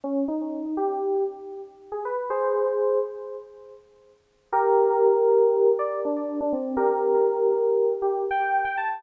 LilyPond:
\new Staff { \time 9/8 \key f \minor \tempo 4. = 80 des'8 ees'4 g'4 r4 r16 aes'16 b'8 | <aes' c''>4. r2. | \key g \minor <g' bes'>2~ <g' bes'>8 d''8 d'8. d'16 c'8 | <g' bes'>2~ <g' bes'>8 g'8 g''8. g''16 a''8 | }